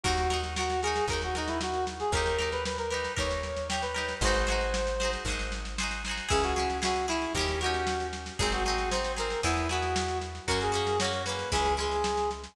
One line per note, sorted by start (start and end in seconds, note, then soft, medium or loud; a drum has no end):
0.03 1.01 D#2 medium
0.03 0.28 D#4 medium
0.03 0.40 F#4 medium
0.03 0.28 F#4 medium
0.03 0.28 A#4 medium
0.03 kick loud
0.03 snare medium
0.17 snare medium
0.30 0.54 D#4 medium
0.30 0.54 F#4 medium
0.30 0.54 A#4 medium
0.30 snare medium
0.43 snare medium
0.56 0.80 F#4 medium
0.56 0.81 F#4 medium
0.56 0.81 A#4 medium
0.56 snare loud
0.61 0.81 D#4 medium
0.70 snare medium
0.82 1.08 F#4 medium
0.82 1.05 G#4 medium
0.82 1.08 A#4 medium
0.82 snare medium
0.87 1.08 D#4 medium
0.96 snare medium
1.08 2.04 D#2 medium
1.08 1.21 A#4 medium
1.08 1.34 A#4 medium
1.08 kick medium
1.08 snare medium
1.12 1.34 D#4 medium
1.12 1.34 F#4 medium
1.22 1.36 F#4 medium
1.22 snare medium
1.35 1.49 D#4 medium
1.35 2.07 D#4 soft
1.35 2.07 F#4 medium
1.35 2.07 A#4 medium
1.35 snare medium
1.47 1.60 E4 medium
1.47 snare medium
1.61 1.85 F#4 medium
1.61 snare loud
1.74 snare medium
1.87 snare medium
2.00 2.12 G#4 medium
2.00 snare medium
2.12 3.08 D#2 medium
2.12 2.37 G4 medium
2.12 2.50 A#4 medium
2.12 2.37 A#4 medium
2.12 kick loud
2.12 snare medium
2.17 2.37 D#4 medium
2.26 snare medium
2.38 2.87 D#4 medium
2.38 2.87 G4 medium
2.38 2.87 A#4 medium
2.38 snare medium
2.52 2.64 B4 medium
2.52 snare medium
2.65 2.78 B4 medium
2.65 snare loud
2.78 2.91 A#4 medium
2.78 snare medium
2.90 3.14 D#4 medium
2.90 3.14 G4 medium
2.90 3.14 A#4 medium
2.90 3.13 B4 medium
2.90 snare medium
3.04 snare medium
3.17 4.14 D#2 medium
3.17 3.65 D#4 medium
3.17 3.65 G4 medium
3.17 3.65 A#4 medium
3.17 3.68 C#5 medium
3.17 kick medium
3.17 snare medium
3.31 snare medium
3.43 snare medium
3.57 snare medium
3.69 3.94 D#4 medium
3.69 3.94 G4 medium
3.69 3.94 A#4 medium
3.69 3.82 G5 medium
3.69 snare loud
3.82 4.15 B4 medium
3.82 snare medium
3.94 4.18 D#4 medium
3.94 4.18 G4 medium
3.94 4.18 A#4 medium
3.94 snare medium
4.09 snare medium
4.21 5.17 G#1 loud
4.21 4.46 G#4 medium
4.21 4.46 C5 medium
4.21 5.11 C5 medium
4.21 kick loud
4.21 snare medium
4.25 4.46 D#4 medium
4.25 4.46 F#4 medium
4.35 snare medium
4.47 4.95 F#4 medium
4.47 4.95 G#4 medium
4.47 4.95 C5 medium
4.47 snare medium
4.52 4.95 D#4 medium
4.61 snare medium
4.74 snare loud
4.87 snare medium
5.00 5.24 F#4 medium
5.00 5.24 G#4 medium
5.00 5.24 C5 medium
5.00 snare medium
5.05 5.24 D#4 medium
5.13 snare medium
5.25 6.21 G#1 medium
5.25 5.75 G#4 medium
5.25 5.75 C5 medium
5.25 kick medium
5.25 snare medium
5.30 5.75 D#4 medium
5.30 5.75 F#4 medium
5.39 snare medium
5.52 snare medium
5.65 snare medium
5.78 6.02 F#4 medium
5.78 6.02 G#4 medium
5.78 6.02 C5 medium
5.78 snare loud
5.83 6.02 D#4 medium
5.91 snare medium
6.05 6.28 G#4 medium
6.05 6.30 C5 medium
6.05 snare medium
6.09 6.30 D#4 medium
6.09 6.30 F#4 medium
6.17 snare medium
6.29 7.27 C#2 medium
6.29 6.53 C#4 medium
6.29 6.53 E4 medium
6.29 6.53 G#4 medium
6.29 6.43 G#4 medium
6.29 kick loud
6.29 snare medium
6.43 6.54 F#4 medium
6.43 snare medium
6.55 6.80 E4 medium
6.55 6.78 F#4 medium
6.55 6.80 G#4 medium
6.55 snare medium
6.59 6.80 C#4 medium
6.70 snare medium
6.82 7.06 C#4 medium
6.82 7.06 E4 medium
6.82 7.06 F#4 medium
6.82 7.06 G#4 medium
6.82 snare loud
6.96 snare medium
7.08 7.32 C#4 medium
7.08 7.33 E4 medium
7.08 7.32 E4 medium
7.08 7.32 G#4 medium
7.08 snare medium
7.22 snare medium
7.34 8.31 D#2 medium
7.34 7.59 G4 medium
7.34 7.60 G4 medium
7.34 7.60 A#4 medium
7.34 kick medium
7.34 snare medium
7.39 7.60 C#4 medium
7.39 7.60 D#4 medium
7.48 snare medium
7.61 8.33 D#4 medium
7.61 8.06 F#4 medium
7.61 8.33 G4 medium
7.61 8.33 A#4 medium
7.61 snare medium
7.66 8.33 C#4 medium
7.74 snare medium
7.87 snare loud
8.00 snare medium
8.13 snare medium
8.26 snare medium
8.39 9.36 G#1 medium
8.39 8.63 C4 medium
8.39 8.63 D#4 medium
8.39 8.63 G#4 medium
8.39 8.52 G#4 medium
8.39 kick loud
8.39 snare medium
8.52 8.64 F#4 medium
8.52 snare medium
8.64 8.90 D#4 medium
8.64 8.89 F#4 medium
8.64 8.90 G#4 medium
8.64 snare medium
8.69 8.90 C4 medium
8.78 snare medium
8.91 9.16 D#4 medium
8.91 9.16 G#4 medium
8.91 9.12 C5 medium
8.91 snare loud
8.95 9.16 C4 medium
9.04 snare medium
9.17 9.40 C4 medium
9.17 9.40 D#4 medium
9.17 9.40 G#4 medium
9.17 9.41 A#4 medium
9.17 snare medium
9.30 snare medium
9.43 10.40 E2 medium
9.43 9.67 B3 medium
9.43 9.68 E4 medium
9.43 9.67 E4 medium
9.43 9.67 G#4 medium
9.43 kick medium
9.43 snare medium
9.57 snare medium
9.69 10.41 B3 medium
9.69 10.41 E4 medium
9.69 10.18 F#4 medium
9.69 10.41 G#4 medium
9.69 snare medium
9.82 snare medium
9.96 snare loud
10.08 snare medium
10.21 snare medium
10.35 snare medium
10.47 11.44 F#2 medium
10.47 10.72 A#3 medium
10.47 10.72 C#4 medium
10.47 10.72 F#4 medium
10.47 10.60 A#4 medium
10.47 kick medium
10.47 snare medium
10.61 10.73 G#4 medium
10.61 snare medium
10.72 10.96 A#3 medium
10.72 10.96 C#4 medium
10.72 10.96 F#4 medium
10.72 10.98 G#4 medium
10.72 snare medium
10.87 snare medium
11.00 11.25 C#4 medium
11.00 11.25 F#4 medium
11.00 11.22 C#5 medium
11.00 snare loud
11.04 11.25 A#3 medium
11.13 snare medium
11.26 11.50 A#3 medium
11.26 11.50 C#4 medium
11.26 11.50 F#4 medium
11.26 11.51 B4 medium
11.26 snare medium
11.39 snare medium
11.52 12.48 C#2 medium
11.52 11.76 G#3 medium
11.52 11.76 C#4 medium
11.52 11.76 E4 medium
11.52 11.74 G#4 medium
11.52 kick medium
11.52 snare medium
11.65 snare medium
11.77 12.49 G#3 medium
11.77 12.49 C#4 medium
11.77 12.49 E4 medium
11.77 12.30 G#4 medium
11.77 snare medium
11.91 snare medium
12.04 snare loud
12.17 snare medium
12.31 snare medium
12.44 snare medium